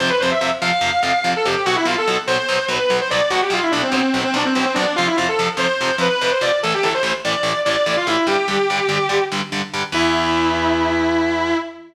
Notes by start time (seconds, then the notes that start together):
0.00 F2 C3 F3 C5
0.10 B4
0.20 F2 C3 F3 C5
0.31 E5
0.41 F2 C3 F3
0.62 F2 C3 F3 F5
0.81 F2 C3 F3
1.03 F2 C3 F3 F5
1.24 F2 C3 F3
1.36 A4
1.45 F2 C3 F3 G4
1.65 B1 B2 F#3 F#4
1.76 E4
1.85 B1 B2 F#3 F4
1.98 A4
2.07 B1 B2 F#3
2.27 B1 B2 F#3 C5
2.49 B1 B2 F#3
2.68 B1 B2 F#3 B4
2.90 B1 B2 F#3
3.01 C5
3.10 B1 B2 F#3 D5
3.30 B1 B2 F#3 F#4
3.42 G4
3.50 B1 B2 F#3 F4
3.62 E4
3.72 B1 B2 F#3 D4
3.83 C4
3.92 B1 B2 F#3 C4
4.14 B1 B2 F#3
4.24 C4
4.34 B1 B2 F#3 D4
4.45 C4
4.55 B1 B2 F#3 C4
4.65 C4
4.74 B1 B2 F#3 D4
4.96 F2 C3 F3 F4
5.07 E4
5.17 F2 C3 F3 F4
5.29 A4
5.39 F2 C3 F3
5.57 F2 C3 F3 C5
5.81 F2 C3 F3
5.98 F2 C3 F3 B4
6.21 F2 C3 F3
6.31 C5
6.41 F2 C3 F3 D5
6.63 A1 A2 E3 A4
6.74 G4
6.83 A1 A2 E3 A4
6.94 C5
7.03 A1 A2 E3
7.25 A1 A2 E3 D5
7.43 A1 A2 E3
7.65 A1 A2 E3 D5
7.86 A1 A2 E3
7.97 F4
8.07 A1 A2 E3 E4
8.27 G2 D3 G3 G4
8.48 G2 D3 G3
8.70 G2 D3 G3
8.89 G2 D3 G3
9.09 G2 D3 G3
9.32 G2 D3 G3
9.52 G2 D3 G3
9.74 G2 D3 G3
9.92 E2 E3 B3 E4